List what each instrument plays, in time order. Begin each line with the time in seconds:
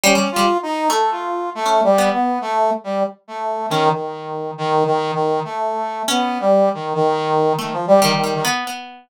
0.04 pizzicato strings G3, brass section C#4
0.15 pizzicato strings G3
0.32 brass section F4
0.36 pizzicato strings G3
0.63 brass section D#4
0.90 pizzicato strings A3, brass section A4
1.11 brass section F4
1.55 brass section A3
1.66 pizzicato strings C#4
1.84 brass section G3
1.98 pizzicato strings B3
2.13 brass section B3
2.41 brass section A3
2.84 brass section G3
3.28 brass section A3
3.70 brass section D#3, pizzicato strings C#4
3.93 brass section D#3
4.58 brass section D#3
4.86 brass section D#3
5.14 brass section D#3
5.45 brass section A3
6.08 brass section B3, pizzicato strings C#4
6.40 brass section G3
6.74 brass section D#3
6.95 brass section D#3
7.59 brass section D#3, pizzicato strings A3
7.73 brass section F3
7.87 brass section G3
8.02 brass section D#3, pizzicato strings G3
8.15 brass section D#3
8.24 pizzicato strings G3
8.34 brass section D#3
8.45 pizzicato strings B3
8.67 pizzicato strings B3